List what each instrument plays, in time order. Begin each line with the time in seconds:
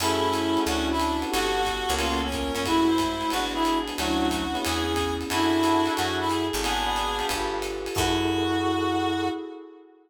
0.00 electric bass (finger) F#2, clarinet A3 C#4 E4, pad 5 (bowed) E4 F#4 G#4 A4, electric piano 1 E4 F#4 G#4 A4, crash, ride
0.33 hi-hat pedal, ride
0.56 electric piano 1 E4 F#4 G#4 A4, ride
0.66 electric bass (finger) D2, pad 5 (bowed) C#4 D4 E4 F#4, electric piano 1 C#4 D4 E4 F#4, clarinet F#4, ride
0.90 clarinet E4
1.00 clarinet D4, hi-hat pedal, ride
1.22 electric piano 1 B3 F#4 G4 A4, ride
1.31 electric bass (finger) G1, pad 5 (bowed) B3 F#4 G4 A4, clarinet F#4 A4, ride
1.65 kick, hi-hat pedal, ride
1.89 electric bass (finger) C#2, electric piano 1 A#3 B3 C#4 F4, ride
1.99 pad 5 (bowed) A#3 B3 C#4 F4, clarinet F4, ride
2.24 clarinet C#4
2.32 clarinet A#4, kick, hi-hat pedal, ride
2.53 electric bass (finger) F#2, clarinet C#4, ride
2.65 pad 5 (bowed) G#3 A3 E4 F#4, electric piano 1 G#3 A3 E4 F#4, clarinet E4 F#4, kick, ride
2.88 clarinet C5
2.98 kick, hi-hat pedal, ride
3.21 ride
3.30 electric bass (finger) G#1, electric piano 1 G#3 B3 D4 F#4, pad 5 (bowed) G#3 B3 D4 F#4, clarinet F#4 B4, ride
3.53 clarinet E4 G#4
3.64 clarinet G#4, hi-hat pedal, ride
3.88 electric piano 1 G#3 B3 D4 F#4, ride
3.97 electric bass (finger) D2, clarinet F#3 A3 F#4, pad 5 (bowed) C#4 D4 E4 F#4, electric piano 1 C#4 D4 E4 F#4, ride
4.31 kick, hi-hat pedal, ride
4.54 electric piano 1 B3 C#4 E4 G#4, clarinet B3, ride
4.64 electric bass (finger) E2, pad 5 (bowed) B3 C#4 E4 G#4, clarinet G#4, ride
4.96 kick, hi-hat pedal, ride
5.21 ride
5.30 electric bass (finger) F#2, clarinet D4 E4 F#4, pad 5 (bowed) E4 F#4 G#4 A4, electric piano 1 E5 F#5 G#5 A5, ride
5.63 electric piano 1 E5 F#5 G#5 A5, hi-hat pedal, ride
5.86 electric piano 1 E5 F#5 G#5 A5, ride
5.96 electric bass (finger) F#2, pad 5 (bowed) E4 F#4 G#4 A4, clarinet F#4, electric piano 1 E5 F#5 G#5 A5, ride
6.19 clarinet E4
6.29 clarinet G#4, hi-hat pedal, ride
6.53 electric bass (finger) G#1, ride
6.63 clarinet B3 D4 G#4, pad 5 (bowed) D4 F#4 G#4 B4, electric piano 1 D5 F#5 G#5 B5, ride
6.86 electric piano 1 D5 F#5 G#5 B5
6.96 hi-hat pedal, ride
7.18 electric piano 1 F5 G5 A5 B5, ride
7.29 electric bass (finger) G1, pad 5 (bowed) F4 G4 A4 B4, kick, ride
7.62 hi-hat pedal, ride
7.86 ride
7.95 electric bass (finger) F#2, electric piano 1 E4 F#4 G#4 A4, pad 5 (bowed) E4 F#4 G#4 A4, clarinet F#4, kick, crash